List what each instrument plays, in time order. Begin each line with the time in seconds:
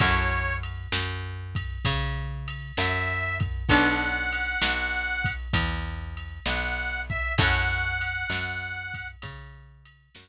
0.00 electric bass (finger) F#2, acoustic guitar (steel) C#4 E4 F#4 A4, harmonica C#5, kick, ride
0.63 ride
0.92 electric bass (finger) F#2, snare
1.55 kick, ride
1.85 electric bass (finger) C#3, kick, ride
2.48 ride
2.77 electric bass (finger) F#2, harmonica E5, snare
3.40 kick, ride
3.68 electric bass (finger) B1, acoustic guitar (steel) B3 D4 F#4 A4, harmonica F#5, kick, ride
4.33 ride
4.62 electric bass (finger) B1, snare
5.24 kick, ride
5.53 electric bass (finger) E2, kick, ride
6.17 ride
6.46 electric bass (finger) B1, harmonica F#5, snare
7.10 harmonica E5, kick
7.38 electric bass (finger) F#2, acoustic guitar (steel) C#4 E4 F#4 A4, harmonica F#5, kick, ride
8.01 ride
8.30 electric bass (finger) F#2, snare
8.94 kick, ride
9.22 electric bass (finger) C#3, kick, ride
9.85 ride
10.15 electric bass (finger) F#2, snare